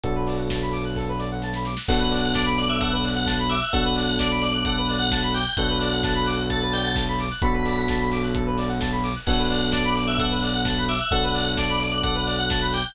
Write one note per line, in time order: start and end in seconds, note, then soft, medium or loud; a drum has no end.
0.03 1.74 B1 loud
0.03 1.70 B3 medium
0.03 1.70 D4 loud
0.03 1.70 F#4 medium
0.03 0.14 A4 medium
0.03 1.70 A4 medium
0.03 kick loud
0.03 closed hi-hat loud
0.15 0.26 B4 medium
0.27 0.37 D5 medium
0.27 snare medium
0.27 open hi-hat medium
0.38 0.49 F#5 medium
0.49 0.61 A5 medium
0.49 kick medium
0.49 snare loud
0.61 0.72 B5 medium
0.72 0.83 D6 medium
0.72 open hi-hat medium
0.85 0.95 F#6 medium
0.96 1.07 A4 medium
0.96 kick medium
0.96 snare medium
1.08 1.19 B4 medium
1.19 1.29 D5 medium
1.19 snare medium
1.32 1.42 F#5 medium
1.42 1.53 A5 medium
1.42 snare medium
1.53 1.65 B5 medium
1.53 snare medium
1.65 1.76 D6 medium
1.65 snare medium
1.77 1.87 F#6 medium
1.77 snare loud
1.88 3.58 B1 loud
1.88 3.55 B3 loud
1.88 3.55 D4 loud
1.88 3.55 F#4 loud
1.88 1.98 A4 loud
1.88 3.55 A4 loud
1.88 2.34 F#5 loud
1.88 kick loud
1.88 crash loud
1.99 2.10 B4 medium
2.11 2.21 D5 medium
2.11 snare medium
2.11 open hi-hat medium
2.23 2.34 F#5 medium
2.34 2.56 D5 medium
2.34 2.44 A5 medium
2.34 kick loud
2.34 snare loud
2.46 2.56 B5 medium
2.58 2.69 D5 medium
2.58 2.68 D6 medium
2.58 open hi-hat medium
2.69 2.81 E5 medium
2.69 2.79 F#6 medium
2.81 2.91 A4 medium
2.81 3.10 F#5 medium
2.81 kick loud
2.81 closed hi-hat loud
2.92 3.03 B4 medium
3.03 3.14 D5 medium
3.03 open hi-hat loud
3.15 3.43 F#5 medium
3.15 3.25 F#5 medium
3.26 3.36 A5 medium
3.26 kick loud
3.26 snare loud
3.39 3.49 B5 medium
3.50 3.71 E5 medium
3.50 3.60 D6 medium
3.50 open hi-hat medium
3.62 3.72 F#6 medium
3.73 5.43 B1 loud
3.73 5.39 B3 loud
3.73 5.39 D4 loud
3.73 5.39 F#4 loud
3.73 3.83 A4 loud
3.73 5.39 A4 loud
3.73 4.12 F#5 loud
3.73 kick loud
3.73 closed hi-hat loud
3.84 3.95 B4 medium
3.96 4.07 D5 medium
3.96 snare medium
3.96 open hi-hat loud
4.07 4.18 F#5 medium
4.19 4.41 D5 loud
4.19 4.30 A5 medium
4.19 kick loud
4.19 snare loud
4.31 4.41 B5 medium
4.42 4.53 D5 loud
4.42 4.53 D6 medium
4.42 open hi-hat medium
4.54 4.65 D5 medium
4.54 4.65 F#6 medium
4.65 4.76 A4 medium
4.65 4.94 F#5 medium
4.65 kick loud
4.65 closed hi-hat loud
4.78 4.88 B4 medium
4.89 5.00 D5 medium
4.89 open hi-hat medium
4.99 5.29 F#5 medium
4.99 5.10 F#5 medium
5.11 5.22 A5 medium
5.11 kick loud
5.11 snare loud
5.22 5.33 B5 medium
5.34 5.54 G5 medium
5.34 5.45 D6 medium
5.34 open hi-hat medium
5.46 5.57 F#6 medium
5.57 7.27 B1 loud
5.57 7.24 B3 loud
5.57 7.24 D4 loud
5.57 7.24 F#4 loud
5.57 5.68 A4 loud
5.57 7.24 A4 medium
5.57 6.44 F#5 medium
5.57 kick loud
5.57 closed hi-hat loud
5.70 5.80 B4 medium
5.80 5.91 D5 medium
5.80 snare medium
5.80 open hi-hat medium
5.92 6.03 F#5 medium
6.03 6.14 A5 medium
6.03 kick loud
6.03 snare loud
6.15 6.25 B5 medium
6.26 6.37 D6 medium
6.26 open hi-hat medium
6.39 6.50 F#6 medium
6.50 6.61 A4 medium
6.50 6.71 A5 medium
6.50 kick medium
6.50 closed hi-hat loud
6.62 6.72 B4 medium
6.73 6.83 D5 medium
6.73 6.84 G5 medium
6.73 open hi-hat loud
6.85 6.95 F#5 medium
6.85 6.96 A5 medium
6.96 7.06 A5 medium
6.96 kick loud
6.96 snare loud
7.08 7.18 B5 medium
7.19 7.30 D6 medium
7.19 open hi-hat loud
7.31 7.41 F#6 medium
7.42 9.12 B1 loud
7.42 9.09 B3 medium
7.42 9.09 D4 medium
7.42 9.09 F#4 loud
7.42 9.09 A4 loud
7.42 7.53 A4 loud
7.42 8.03 B5 loud
7.42 kick loud
7.42 closed hi-hat loud
7.54 7.64 B4 medium
7.65 7.76 D5 medium
7.65 snare medium
7.65 open hi-hat medium
7.77 7.88 F#5 medium
7.88 7.99 A5 medium
7.88 kick loud
7.88 snare loud
8.00 8.11 B5 medium
8.12 8.22 D6 medium
8.12 open hi-hat loud
8.23 8.34 F#6 medium
8.35 8.45 A4 medium
8.35 kick loud
8.35 closed hi-hat loud
8.47 8.57 B4 medium
8.58 8.68 D5 medium
8.58 open hi-hat loud
8.69 8.79 F#5 medium
8.81 8.91 A5 medium
8.81 kick loud
8.81 snare loud
8.92 9.02 B5 medium
9.03 9.14 D6 medium
9.03 open hi-hat loud
9.15 9.26 F#6 medium
9.27 10.97 B1 loud
9.27 10.93 B3 loud
9.27 10.93 D4 loud
9.27 10.93 F#4 loud
9.27 10.93 A4 loud
9.27 9.38 A4 loud
9.27 9.72 F#5 loud
9.27 kick loud
9.27 crash loud
9.38 9.48 B4 medium
9.50 9.60 D5 medium
9.50 snare medium
9.50 open hi-hat medium
9.61 9.72 F#5 medium
9.72 9.94 D5 medium
9.72 9.83 A5 medium
9.72 kick loud
9.72 snare loud
9.85 9.95 B5 medium
9.96 10.07 D5 medium
9.96 10.07 D6 medium
9.96 open hi-hat medium
10.08 10.19 E5 medium
10.08 10.18 F#6 medium
10.19 10.30 A4 medium
10.19 10.49 F#5 medium
10.19 kick loud
10.19 closed hi-hat loud
10.30 10.41 B4 medium
10.43 10.53 D5 medium
10.43 open hi-hat loud
10.54 10.83 F#5 medium
10.54 10.65 F#5 medium
10.65 10.75 A5 medium
10.65 kick loud
10.65 snare loud
10.77 10.88 B5 medium
10.88 11.11 E5 medium
10.88 10.98 D6 medium
10.88 open hi-hat medium
11.00 11.10 F#6 medium
11.11 12.81 B1 loud
11.11 12.78 B3 loud
11.11 12.78 D4 loud
11.11 12.78 F#4 loud
11.11 11.22 A4 loud
11.11 12.78 A4 loud
11.11 11.51 F#5 loud
11.11 kick loud
11.11 closed hi-hat loud
11.23 11.34 B4 medium
11.34 11.44 D5 medium
11.34 snare medium
11.34 open hi-hat loud
11.46 11.56 F#5 medium
11.57 11.79 D5 loud
11.57 11.68 A5 medium
11.57 kick loud
11.57 snare loud
11.69 11.80 B5 medium
11.80 11.91 D5 loud
11.80 11.91 D6 medium
11.80 open hi-hat medium
11.92 12.03 D5 medium
11.92 12.03 F#6 medium
12.03 12.14 A4 medium
12.03 12.32 F#5 medium
12.03 kick loud
12.03 closed hi-hat loud
12.15 12.25 B4 medium
12.26 12.37 D5 medium
12.26 open hi-hat medium
12.39 12.49 F#5 medium
12.39 12.68 F#5 medium
12.50 12.60 A5 medium
12.50 kick loud
12.50 snare loud
12.62 12.72 B5 medium
12.73 12.93 G5 medium
12.73 12.84 D6 medium
12.73 open hi-hat medium
12.85 12.95 F#6 medium